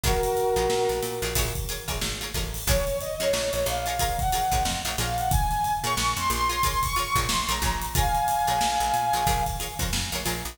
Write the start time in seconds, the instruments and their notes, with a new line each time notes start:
0.03 electric bass (finger) A#1, pizzicato strings F4 G#4 A#4 C#5, brass section F#4 A#4, kick, closed hi-hat
0.23 closed hi-hat
0.37 snare, closed hi-hat
0.56 electric bass (finger) A#1, pizzicato strings F4 G#4 A#4 C#5, closed hi-hat
0.70 electric bass (finger) A#2, snare
0.89 electric bass (finger) A#1, closed hi-hat
1.02 electric bass (finger) A#2, snare, closed hi-hat
1.22 electric bass (finger) A#1, pizzicato strings F4 G#4 A#4 C#5, closed hi-hat
1.35 electric bass (finger) A#1, pizzicato strings F4 G#4 A#4 C#5, kick, closed hi-hat
1.55 kick, closed hi-hat
1.68 pizzicato strings F4 G#4 A#4 C#5, snare, closed hi-hat
1.88 electric bass (finger) A#1, pizzicato strings F4 G#4 A#4 C#5, kick, closed hi-hat
2.01 electric bass (finger) G#1, snare
2.21 pizzicato strings F4 G#4 A#4 C#5, closed hi-hat
2.34 electric bass (finger) A1, pizzicato strings F4 G#4 A#4 C#5, kick, snare, closed hi-hat
2.54 open hi-hat
2.67 electric bass (finger) A#1, pizzicato strings F4 G#4 A#4 C#5, brass section C#5, kick, closed hi-hat
2.87 snare, closed hi-hat
3.01 brass section D#5, closed hi-hat
3.20 electric bass (finger) F2, pizzicato strings F4 G#4 A#4 C#5, brass section C#5, snare, closed hi-hat
3.33 electric bass (finger) A#1, snare
3.53 electric bass (finger) A#1, brass section C#5, closed hi-hat
3.66 electric bass (finger) A#1, brass section F5, closed hi-hat
3.86 pizzicato strings F4 G#4 A#4 C#5, closed hi-hat
3.99 pizzicato strings F4 G#4 A#4 C#5, kick, closed hi-hat
4.19 brass section F#5, kick, closed hi-hat
4.32 pizzicato strings F4 G#4 A#4 C#5, closed hi-hat
4.51 electric bass (finger) A#1, pizzicato strings F4 G#4 A#4 C#5, kick, closed hi-hat
4.65 electric bass (finger) F2, snare
4.85 electric bass (finger) A#1, pizzicato strings F4 G#4 A#4 C#5, closed hi-hat
4.98 electric bass (finger) A#1, pizzicato strings F4 G#4 A#4 C#5, brass section F5, snare, closed hi-hat
5.18 brass section F#5, closed hi-hat
5.31 brass section G#5, kick, closed hi-hat
5.51 snare, closed hi-hat
5.64 closed hi-hat
5.84 electric bass (finger) A#2, pizzicato strings F4 G#4 A#4 C#5, brass section C#6, closed hi-hat
5.97 electric bass (finger) A#1, snare
6.16 electric bass (finger) F2, brass section C6, closed hi-hat
6.30 electric bass (finger) A#1, brass section C6, snare, closed hi-hat
6.49 pizzicato strings F4 G#4 A#4 C#5, closed hi-hat
6.63 pizzicato strings F4 G#4 A#4 C#5, kick, closed hi-hat
6.83 brass section C#6, kick, closed hi-hat
6.96 pizzicato strings F4 G#4 A#4 C#5, brass section C#6, closed hi-hat
7.16 electric bass (finger) A#1, pizzicato strings F4 G#4 A#4 C#5, kick, closed hi-hat
7.29 electric bass (finger) A#1, brass section C6, snare
7.48 electric bass (finger) A#1, pizzicato strings F4 G#4 A#4 C#5, brass section A#5, closed hi-hat
7.62 electric bass (finger) A#1, pizzicato strings F4 G#4 A#4 C#5, kick, snare, closed hi-hat
7.81 closed hi-hat
7.95 pizzicato strings F4 G#4 A#4 C#5, brass section F5 G#5, kick, closed hi-hat
8.15 closed hi-hat
8.28 snare, closed hi-hat
8.47 electric bass (finger) A#1, pizzicato strings F4 G#4 A#4 C#5, closed hi-hat
8.61 electric bass (finger) A#1, snare
8.80 electric bass (finger) A#1, closed hi-hat
8.94 electric bass (finger) A#2, closed hi-hat
9.13 electric bass (finger) A#1, pizzicato strings F4 G#4 A#4 C#5, closed hi-hat
9.27 electric bass (finger) A#1, pizzicato strings F4 G#4 A#4 C#5, kick, closed hi-hat
9.46 kick, snare, closed hi-hat
9.60 pizzicato strings F4 G#4 A#4 C#5, snare, closed hi-hat
9.79 electric bass (finger) F2, pizzicato strings F4 G#4 A#4 C#5, kick, snare, closed hi-hat
9.93 electric bass (finger) F2, snare
10.12 electric bass (finger) A#1, pizzicato strings F4 G#4 A#4 C#5, closed hi-hat
10.25 electric bass (finger) A#1, pizzicato strings F4 G#4 A#4 C#5, snare, closed hi-hat
10.45 electric bass (finger) A#1, closed hi-hat